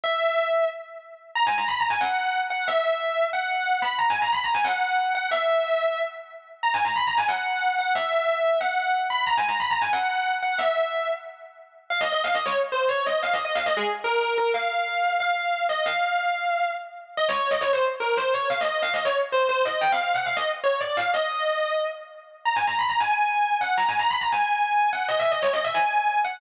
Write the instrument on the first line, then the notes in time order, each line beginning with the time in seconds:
distortion guitar
0.04 E5
1.35 A#5
1.46 G#5
1.58 A#5
1.68 B5
1.80 A#5
1.90 G#5
2.01 F#5
2.50 F#5
2.68 E5
3.33 F#5
3.82 B5
3.99 A#5
4.10 G#5
4.22 A#5
4.33 B5
4.44 A#5
4.54 G#5
4.64 F#5
5.15 F#5
5.31 E5
6.63 A#5
6.74 G#5
6.84 A#5
6.96 B5
7.07 A#5
7.18 G#5
7.28 F#5
7.79 F#5
7.95 E5
8.61 F#5
9.10 B5
9.26 A#5
9.37 G#5
9.48 A#5
9.60 B5
9.70 A#5
9.82 G#5
9.93 F#5
10.42 F#5
10.58 E5
11.90 F5
12.01 D#5
12.12 D#5
12.24 F5
12.35 D#5
12.46 C#5
12.72 C5
12.89 C#5
13.06 D#5
13.23 F5
13.33 D#5
13.45 D#5
13.55 F5
13.66 D#5
13.77 G#4
14.04 A#4
14.21 A#4
14.38 A#4
14.54 F5
15.20 F5
15.69 D#5
15.86 F5
17.17 D#5
17.29 C#5
17.39 C#5
17.51 D#5
17.61 C#5
17.73 C5
18.00 A#4
18.17 C5
18.34 C#5
18.50 F5
18.61 D#5
18.72 D#5
18.82 F5
18.94 D#5
19.05 C#5
19.32 C5
19.49 C5
19.65 D#5
19.81 G5
19.92 F5
20.04 F5
20.14 F#5
20.25 F5
20.37 D#5
20.64 C#5
20.81 D5
20.97 F5
21.14 D#5
22.45 A#5
22.56 G#5
22.67 A#5
22.79 B5
22.89 A#5
23.00 G#5
23.11 G#5
23.61 F#5
23.77 A#5
23.89 G#5
23.99 A#5
24.10 B5
24.21 A#5
24.32 G#5
24.43 G#5
24.93 F#5
25.09 D#5
25.19 E5
25.31 D#5
25.42 C#5
25.53 D#5
25.64 E5
25.74 G#5
26.25 F#5